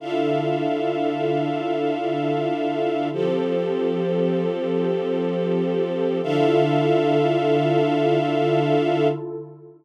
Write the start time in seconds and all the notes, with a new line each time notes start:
0.00 D3 D4 E4 F4 A4 E5 F5
3.12 F3 C4 G4 A4 C5
6.23 D3 D4 E4 F4 A4 E5 F5